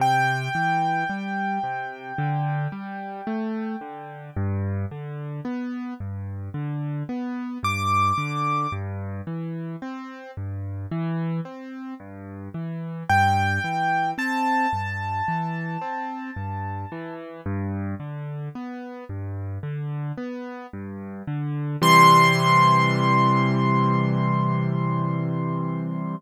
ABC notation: X:1
M:4/4
L:1/8
Q:1/4=55
K:C
V:1 name="Acoustic Grand Piano"
g8 | z6 d'2 | z8 | g2 a6 |
z8 | c'8 |]
V:2 name="Acoustic Grand Piano"
C, E, G, C, D, G, A, D, | G,, D, B, G,, D, B, G,, D, | G,, E, C G,, E, C G,, E, | G,, E, C G,, E, C G,, E, |
G,, D, B, G,, D, B, G,, D, | [C,E,G,]8 |]